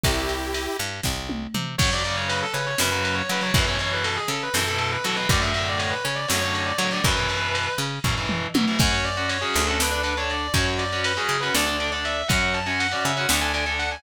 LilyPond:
<<
  \new Staff \with { instrumentName = "Lead 2 (sawtooth)" } { \time 7/8 \key e \minor \tempo 4 = 120 <e' g'>4. r2 | \key fis \minor r2. r8 | r2. r8 | r2. r8 |
r2. r8 | r2. r8 | r2. r8 | r2. r8 | }
  \new Staff \with { instrumentName = "Distortion Guitar" } { \time 7/8 \key e \minor r2. r8 | \key fis \minor cis''16 d''16 d''16 cis''16 b'16 a'16 b'16 cis''16 b'16 b'16 b'16 cis''16 b'16 cis''16 | b'16 cis''16 cis''16 b'16 a'16 gis'16 a'16 b'16 a'16 a'16 a'16 b'16 a'16 b'16 | d''16 e''16 e''16 d''16 cis''16 b'16 cis''16 d''16 cis''16 cis''16 cis''16 d''16 cis''16 d''16 |
b'4. r2 | cis''16 cis''16 d''8 cis''16 gis'8 a'16 b'8. cis''16 d''8 | cis''16 cis''16 d''8 b'16 gis'8 b'16 d''8. d''16 e''8 | fis''16 fis''16 a''16 gis''16 fis''16 d''16 e''16 fis''16 r16 gis''16 gis''16 r16 fis''16 gis''16 | }
  \new Staff \with { instrumentName = "Overdriven Guitar" } { \time 7/8 \key e \minor r2. r8 | \key fis \minor <cis fis>16 <cis fis>16 <cis fis>4. <cis fis>16 <cis fis>8. <cis fis>16 <cis fis>16 | <b, e>16 <b, e>16 <b, e>4. <b, e>16 <b, e>8. <b, e>16 <b, e>16 | <a, d>16 <a, d>16 <a, d>4. <a, d>16 <a, d>8. <a, d>16 <a, d>16 |
<b, e>16 <b, e>16 <b, e>4. <b, e>16 <b, e>8. <b, e>16 <b, e>16 | <cis' fis'>8. <cis' fis'>8 <cis' fis'>8 <cis' fis'>16 <d' a'>16 <d' a'>16 <d' a'>16 <d' a'>8. | <cis' fis'>8. <cis' fis'>8 <cis' fis'>8 <cis' fis'>16 <d' a'>16 <d' a'>16 <d' a'>16 <d' a'>8. | <cis' fis'>8. <cis' fis'>8 <cis' fis'>8 <cis' fis'>16 <d' a'>16 <d' a'>16 <d' a'>16 <d' a'>8. | }
  \new Staff \with { instrumentName = "Electric Bass (finger)" } { \clef bass \time 7/8 \key e \minor c,4. g,8 c,4 c8 | \key fis \minor fis,4. cis8 fis,4 fis8 | fis,4. cis8 fis,4 fis8 | fis,4. cis8 fis,4 fis8 |
fis,4. cis8 fis,4 fis8 | fis,4. d,2 | fis,4. cis8 d,4. | fis,4. cis8 d,4. | }
  \new DrumStaff \with { instrumentName = "Drums" } \drummode { \time 7/8 <bd cymr>8 cymr8 cymr8 cymr8 <bd sn>8 tommh8 toml8 | <cymc bd>8 cymr8 cymr8 cymr8 sn8 cymr8 cymr8 | <bd cymr>8 cymr8 cymr8 cymr8 sn8 cymr8 cymr8 | <bd cymr>8 cymr8 cymr8 cymr8 sn8 cymr8 cymr8 |
<bd cymr>8 cymr8 cymr8 cymr8 <bd tomfh>8 toml8 tommh8 | <cymc bd>8 cymr8 cymr8 cymr8 sn8 cymr8 cymr8 | <bd cymr>8 cymr8 cymr8 cymr8 sn8 cymr8 cymr8 | <bd cymr>8 cymr8 cymr8 cymr8 sn8 cymr8 cymr8 | }
>>